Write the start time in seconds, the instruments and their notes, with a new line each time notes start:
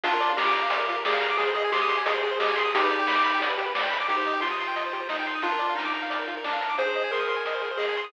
0.04 synth bass 1 A#1, lead 1 (square) D4 F4, kick, closed hi-hat
0.13 lead 1 (square) A#4
0.20 synth bass 1 A#2, lead 1 (square) D5, closed hi-hat
0.29 lead 1 (square) F5
0.37 synth bass 1 A#1, lead 1 (square) G4 A#5, snare
0.46 lead 1 (square) D6
0.54 synth bass 1 A#2, lead 1 (square) A#5, closed hi-hat
0.62 lead 1 (square) F5
0.70 synth bass 1 A#1, lead 1 (square) D5, kick, closed hi-hat
0.79 lead 1 (square) A#4
0.88 synth bass 1 A#2, lead 1 (square) F4, closed hi-hat
0.96 lead 1 (square) A#4
1.04 synth bass 1 A#1, lead 1 (square) G#4 D5, snare
1.13 lead 1 (square) F5
1.21 synth bass 1 A#2, lead 1 (square) A#5, closed hi-hat
1.30 lead 1 (square) D6
1.37 synth bass 1 G#1, lead 1 (square) G#4, kick, closed hi-hat
1.47 lead 1 (square) C5
1.54 synth bass 1 G#2, lead 1 (square) G#4 D#5, closed hi-hat
1.64 lead 1 (square) G#5
1.72 synth bass 1 G#1, lead 1 (square) G4 C6, snare
1.82 lead 1 (square) D#6
1.89 synth bass 1 G#2, lead 1 (square) C6, closed hi-hat
1.97 lead 1 (square) G#5
2.05 synth bass 1 G#1, lead 1 (square) G#4 D#5, kick, closed hi-hat
2.14 lead 1 (square) C5
2.22 synth bass 1 G#2, lead 1 (square) G#4, closed hi-hat
2.31 lead 1 (square) C5
2.39 synth bass 1 G#1, lead 1 (square) G4 D#5, snare
2.49 lead 1 (square) G#5
2.56 synth bass 1 G#2, lead 1 (square) G#4 C6, closed hi-hat
2.65 lead 1 (square) D#6
2.73 synth bass 1 G1, lead 1 (square) D#4 G4, kick, closed hi-hat
2.83 lead 1 (square) B4
2.90 synth bass 1 G2, lead 1 (square) D5, closed hi-hat
2.99 lead 1 (square) G5
3.07 synth bass 1 G1, lead 1 (square) B5, snare
3.15 lead 1 (square) D6
3.24 synth bass 1 G2, lead 1 (square) B5, closed hi-hat
3.34 lead 1 (square) G5
3.41 synth bass 1 G1, lead 1 (square) D5, kick, closed hi-hat
3.50 lead 1 (square) B4
3.58 synth bass 1 G2, lead 1 (square) G4, closed hi-hat
3.66 lead 1 (square) B4
3.75 synth bass 1 G1, lead 1 (square) D5, snare
3.83 lead 1 (square) G5
3.90 synth bass 1 G2, lead 1 (square) B5, closed hi-hat
4.00 lead 1 (square) D6
4.08 synth bass 1 C2, lead 1 (square) D#4 G4, kick, closed hi-hat
4.17 lead 1 (square) C5
4.25 synth bass 1 C3, lead 1 (square) D#5, closed hi-hat
4.33 lead 1 (square) G5
4.41 synth bass 1 C2, lead 1 (square) F4 C6, snare
4.51 lead 1 (square) D#6
4.58 synth bass 1 C3, lead 1 (square) C6, closed hi-hat
4.67 lead 1 (square) G5
4.76 synth bass 1 C2, lead 1 (square) D#5, kick, closed hi-hat
4.85 lead 1 (square) C5
4.93 synth bass 1 C3, lead 1 (square) G4, closed hi-hat
5.00 lead 1 (square) C5
5.09 synth bass 1 C2, lead 1 (square) D#4 D#5, snare
5.19 lead 1 (square) G5
5.26 synth bass 1 C3, lead 1 (square) C6, closed hi-hat
5.35 lead 1 (square) D#6
5.42 synth bass 1 A#1, lead 1 (square) D4 F4, kick, closed hi-hat
5.52 lead 1 (square) A#4
5.59 synth bass 1 A#2, lead 1 (square) D5, closed hi-hat
5.69 lead 1 (square) F5
5.75 synth bass 1 A#1, lead 1 (square) D#4 A#5, snare
5.85 lead 1 (square) D6
5.94 synth bass 1 A#2, lead 1 (square) A#5, closed hi-hat
6.02 lead 1 (square) F5
6.10 synth bass 1 A#1, lead 1 (square) D5, kick, closed hi-hat
6.19 lead 1 (square) A#4
6.27 synth bass 1 A#2, lead 1 (square) F4, closed hi-hat
6.37 lead 1 (square) A#4
6.44 synth bass 1 A#1, lead 1 (square) D4 D5, snare
6.53 lead 1 (square) F5
6.61 synth bass 1 A#2, lead 1 (square) A#5, closed hi-hat
6.69 lead 1 (square) D6
6.78 synth bass 1 G#1, lead 1 (square) G#4 C5, kick, closed hi-hat
6.87 lead 1 (square) C5
6.94 synth bass 1 G#2, lead 1 (square) D#5, closed hi-hat
7.04 lead 1 (square) G#5
7.11 synth bass 1 G#1, lead 1 (square) A#4 C6, snare
7.20 lead 1 (square) D#6
7.29 synth bass 1 G#2, lead 1 (square) C6, closed hi-hat
7.36 lead 1 (square) G#5
7.45 synth bass 1 G#1, lead 1 (square) D#5, kick, closed hi-hat
7.54 lead 1 (square) C5
7.62 synth bass 1 G#2, lead 1 (square) G#4, closed hi-hat
7.71 lead 1 (square) C5
7.77 synth bass 1 G#1, lead 1 (square) G#4 D#5, snare
7.89 lead 1 (square) G#5
7.96 synth bass 1 G#2, lead 1 (square) C6, closed hi-hat
8.04 lead 1 (square) D#6